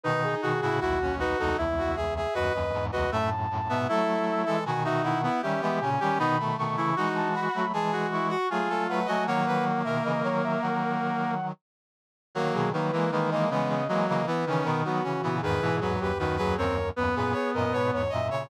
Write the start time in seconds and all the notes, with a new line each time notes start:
0.04 B2 D#3 D#4 B4
0.23 G#4
0.42 B2 D#3 F#4 G#4
0.62 A2 C#3 E4 F#4
0.80 B1 D#2 E4 F#4
1.01 C#4
1.19 D#4 F#4 B4
1.38 C#2 E2 D#4 A4
1.58 C#2 E2 E4 E5
1.78 F#4
1.96 G#4 E5
2.16 G#4 E5
2.34 D#2 F#2 F#4 B4 D#5
2.53 D#2 F#2 D#5
2.73 E2 G#2
2.92 C#2 E2 F#4 B4 D#5
3.11 F#2 A2 A3 E5 A5
3.50 F#2 A2
3.69 G#2 B2 B3 E5
3.88 F#3 A3 E4 A4 E5
4.46 E3 G#3 A4
4.65 B2 D#3 F#4 G#5
4.84 D#4 F#4 E5
5.03 E4 F#5
5.23 B3 E4
5.42 D#3 G3 C#4 G4 E5
5.61 E3 G#3 B3 E5
5.81 A#2 C#3 C#4 G#5
6.00 D#3 G3 C#4 G4
6.17 B2 D#3 B3 D#4 B5
6.39 A3
6.57 B2 D#3 A3 C#6
6.77 C#3 E3 E4 C#6
6.96 E3 G#3 D#4 F#4
7.16 A5
7.33 F#4 B5
7.54 F#3 A3 B5
7.73 E3 G#3 G#4 A5
7.92 F#4
8.12 E4 C#6
8.29 F#4 C#6
8.50 F#3 A3 F4 G#4 G#5
8.69 F#3 A3 A4
8.88 F#3 A3 B4 F#5
9.05 F#3 A3 F#4 D#5 G#5
9.26 D#3 F#3 A#3 C#5 F#5
9.46 B4
9.84 B2 D#3 A#4 E5
10.04 C#3 E3 D#5
10.23 D#3 F#3 C#5
10.43 E5
10.62 D#3 F#3 F#5
12.35 D#3 F#3 A#3 A#4
12.53 B2 D#3 G#4
12.73 D#3 F#3 A#3 B4
12.92 E3 G#3 A#3
13.12 D#3 E3 G#3 A#3 B4
13.31 E3 G#3 A#3 D#5
13.50 C#3 E3 G#3 B3 D#5
13.69 C#3 D#5
13.88 E3 F#3 G#3 A#3 D#5
14.08 C#3 E3 A#3 D#5
14.26 E3 B3 B4
14.46 C#3 D#3 E3 C#4
14.64 B2 D#3 B3 A#4
14.85 D#3 F#3 B3 F#4
15.03 C#3 E3 C#4
15.22 A#2 C#3 E3 B3
15.42 E2 G#2 D#3 G#4 B4
15.62 G#2 B2 E3
15.81 E2 G#2 F#3 B4
16.00 D#2 F#2 G4 B4
16.18 D#2 F#2 D#3 F#4 B4
16.36 D#2 F#2 F#3 G#4 B4
16.57 D#2 F#2 C4 A#4 C#5
16.96 D#2 F#2 B3 B4
17.15 F#2 A#2 G#4 B4
17.32 G#4 C#5
17.54 F#2 A#2 A#4 D#5
17.72 G#2 B2 B4 C#5
17.92 E2 G#2 C#5
18.09 F#2 A#2 D#5 E5
18.30 A#2 C#3 C#5